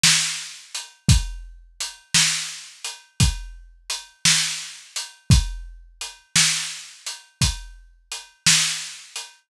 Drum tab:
HH |--x|x-x--xx-x--x|x-x--xx-x--x|
SD |o--|---o-----o--|---o-----o--|
BD |---|o-----o-----|o-----o-----|